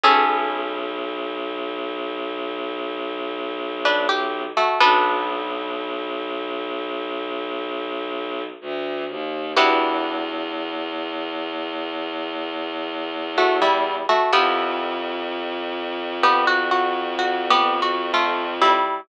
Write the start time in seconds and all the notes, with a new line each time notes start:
0.04 B1 B3 C#4 G#4 A4
3.85 D4 B4
4.09 G4
4.57 A3 F#4
4.80 B1 B3 D4 F#4 A4 B4
8.61 D2
9.09 D#2
9.57 E2 B3 D4 E4 F#4 G4
13.38 A3 F#4
13.62 G3 E4
14.09 A3 F#4
14.33 F2 B3 E4 F4 G4 A4
16.23 B3 G4
16.47 F#4
16.71 F#4
17.19 F#4
17.50 B3 G4
17.82 F#4
18.14 A3 F4
18.62 G3 E4